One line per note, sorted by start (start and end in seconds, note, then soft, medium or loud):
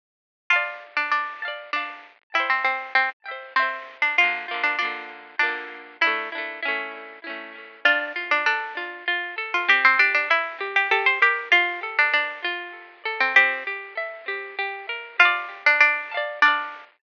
0.50 0.94 F4 medium
0.50 1.35 F5 medium
0.50 1.35 A5 medium
0.56 1.35 D5 medium
0.97 1.11 D4 medium
1.11 1.63 D4 medium
1.42 1.70 F5 medium
1.42 1.70 A5 medium
1.48 1.70 D5 medium
1.73 2.15 D4 medium
1.73 2.29 F5 medium
1.73 2.29 A5 medium
1.79 2.29 D5 medium
2.34 2.49 E4 medium
2.34 3.18 E5 medium
2.34 3.18 G5 medium
2.40 3.18 C5 medium
2.50 2.64 C4 medium
2.65 2.93 C4 medium
2.95 3.10 C4 medium
3.26 3.54 E5 medium
3.26 3.54 G5 medium
3.31 3.54 C5 medium
3.56 3.97 C4 medium
3.56 4.13 E5 medium
3.56 4.13 G5 medium
3.62 4.13 C5 medium
4.02 4.17 D4 medium
4.18 4.46 A#3 medium
4.18 4.46 F4 medium
4.18 4.60 F4 medium
4.24 4.46 D3 medium
4.48 4.76 A#3 medium
4.48 4.76 F4 medium
4.54 4.76 D3 medium
4.64 4.78 D4 medium
4.79 5.35 A#3 medium
4.79 5.37 D4 medium
4.79 5.35 F4 medium
4.85 5.35 D3 medium
5.39 5.97 A#3 medium
5.39 5.79 D4 medium
5.39 5.97 F4 medium
5.46 5.97 D3 medium
6.01 6.29 D4 medium
6.01 6.29 E4 medium
6.01 6.87 E4 medium
6.07 6.29 A3 medium
6.32 6.60 D4 medium
6.32 6.60 E4 medium
6.38 6.60 A3 medium
6.63 7.19 C#4 medium
6.63 7.19 E4 medium
6.68 7.19 A3 medium
7.24 7.80 C#4 medium
7.24 7.80 E4 medium
7.30 7.80 A3 medium
7.85 8.13 D4 loud
7.85 8.29 F4 medium
8.16 8.43 F4 loud
8.31 8.46 D4 medium
8.46 9.05 D4 medium
8.46 8.74 A4 medium
8.77 9.05 F4 loud
9.08 9.35 F4 loud
9.38 9.65 A4 loud
9.54 9.69 F4 medium
9.68 9.96 C4 loud
9.68 9.84 G4 medium
9.85 9.99 C4 medium
9.99 10.14 D4 medium
9.99 10.27 G4 loud
10.15 10.29 D4 medium
10.30 10.68 E4 medium
10.30 10.58 E5 medium
10.61 10.88 G4 medium
10.76 10.91 G4 medium
10.91 11.19 G4 loud
10.91 11.06 A4 medium
11.06 11.21 C5 medium
11.22 11.48 G4 medium
11.22 11.49 A#4 medium
11.52 11.93 F4 medium
11.52 11.80 F4 loud
11.83 12.11 A4 medium
11.99 12.13 D4 medium
12.14 12.72 D4 medium
12.14 12.41 D5 medium
12.44 13.03 F4 loud
13.05 13.33 A4 medium
13.20 13.35 C4 medium
13.36 13.64 C4 loud
13.36 13.87 G4 medium
13.67 13.95 G4 medium
13.97 14.25 E5 medium
14.28 14.56 G4 medium
14.59 14.86 G4 loud
14.89 15.17 A#4 medium
15.19 15.64 F4 loud
15.19 16.04 F5 loud
15.19 16.04 A5 loud
15.25 16.04 D5 loud
15.66 15.80 D4 medium
15.80 16.32 D4 medium
16.11 16.40 F5 medium
16.11 16.40 A5 medium
16.17 16.40 D5 loud
16.42 16.84 D4 medium
16.42 16.98 F5 medium
16.42 16.98 A5 medium
16.48 16.98 D5 medium